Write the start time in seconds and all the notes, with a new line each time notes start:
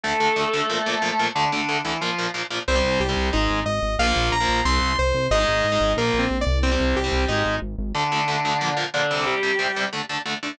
0.04 D2 D3 A3 A4
0.20 D2 D3 A3
0.36 D2 D3 A3
0.53 D2 D3 A3
0.70 A#2 F3 A#3
0.86 A#2 F3 A#3
1.02 A#2 F3 A#3
1.19 A#2 F3 A#3
1.35 D2 D3 A3 D4
1.52 D2 D3 A3 D4
1.69 D2 D3 A3
1.85 D2 D3 E3 A3 E4
2.01 A#2 F3 A#3 F4
2.18 A#2 F3 A#3
2.34 A#2 F3 A#3
2.50 A#2 F3 A#3
2.68 C2 G3 C4 C5
2.75 G3 C4
2.84 C2
3.00 C2 G4
3.09 G3 C4
3.17 C2
3.33 G#1 G#3 D#4
3.50 G#1
3.66 G#1 D#5
3.82 G#1
3.99 A#1 F3 A#3 F5
4.07 F3 A#3
4.16 A#1
4.32 A#1 A#5
4.40 F3 A#3
4.49 A#1
4.65 C2 G3 C4 C6
4.82 C2
4.99 C2 C5
5.14 C2
5.31 G#1 G#3 D#4 D#5
5.40 G#3 D#4
5.48 G#1
5.64 G#1
5.72 G#3 D#4
5.80 G#1
5.97 A#1 F3 A#3 A#4
6.14 A#1
6.19 C4
6.30 A#1
6.41 D5
6.47 C2
6.63 G3 C4
6.72 G3 C4
6.80 C2
6.95 C2 G4
7.04 G3 C4
7.12 C2
7.28 G#1 G#3 D#4
7.45 G#1
7.62 G#1
7.78 G#1
7.95 D2 D3 A3 D4
8.12 D2 D3 A3
8.28 D2 D3 A3
8.45 D2 D3 A3
8.61 A#2 F3 A#3
8.77 A#2 F3 A#3
8.94 A#2 D3 F3 A#3 D4
9.11 C3 G3 C4
9.26 G3 G4
9.43 C3 G3 C4
9.59 C3 G3 C4
9.76 C3 G3 C4
9.93 D3 A3 D4
10.09 D3 A3 D4
10.26 D3 A3 D4
10.43 D3 A3 D4